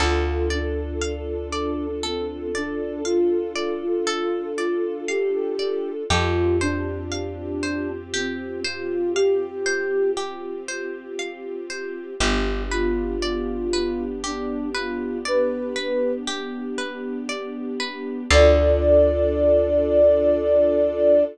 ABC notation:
X:1
M:3/4
L:1/16
Q:1/4=59
K:Ddor
V:1 name="Ocarina"
F2 D6 C2 D2 | F3 F3 F2 G4 | F2 D6 C2 F2 | G4 z8 |
G2 F6 D2 F2 | B4 z8 | d12 |]
V:2 name="Pizzicato Strings"
A2 d2 f2 d2 A2 d2 | f2 d2 A2 d2 f2 d2 | G2 c2 f2 c2 G2 c2 | f2 c2 G2 c2 f2 c2 |
G2 B2 d2 B2 G2 B2 | d2 B2 G2 B2 d2 B2 | [Adf]12 |]
V:3 name="String Ensemble 1"
[DFA]12- | [DFA]12 | [CFG]12- | [CFG]12 |
[B,DG]12- | [B,DG]12 | [DFA]12 |]
V:4 name="Electric Bass (finger)" clef=bass
D,,12- | D,,12 | F,,12- | F,,12 |
G,,,12- | G,,,12 | D,,12 |]